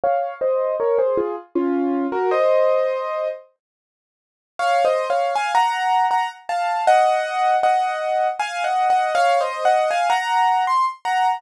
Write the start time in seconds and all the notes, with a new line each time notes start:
0.04 C#5 F5
0.41 C5 D#5
0.80 A#4 C#5
0.98 G#4 C5
1.17 F4 G#4
1.55 C#4 F4
2.12 F#4 A#4
2.31 C5 D#5
4.59 C#5 F5
4.85 C5 D#5
5.10 C#5 F5
5.35 F5 G#5
5.55 F#5 A#5
6.11 F#5 A#5
6.49 F5 A5
6.87 D#5 F#5
7.63 D#5 F#5
8.39 F5 G#5
8.64 D#5 F#5
8.90 D#5 F#5
9.15 C#5 F5
9.41 C5 D#5
9.65 D#5 F#5
9.91 F5 G#5
10.10 F#5 A#5
10.67 C6
11.05 F#5 A#5